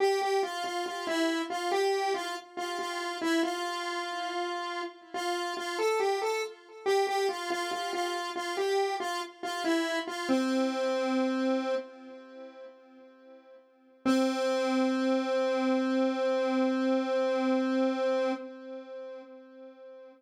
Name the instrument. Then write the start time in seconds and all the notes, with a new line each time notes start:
lead 1 (square)
0.00 G4
0.21 G4
0.43 F4
0.64 F4
0.86 F4
1.07 E4
1.50 F4
1.71 G4
2.14 F4
2.57 F4
2.79 F4
3.21 E4
3.43 F4
5.14 F4
5.57 F4
5.79 A4
6.00 G4
6.22 A4
6.86 G4
7.07 G4
7.29 F4
7.50 F4
7.71 F4
7.93 F4
8.36 F4
8.57 G4
9.00 F4
9.43 F4
9.64 E4
10.07 F4
10.29 C4
14.06 C4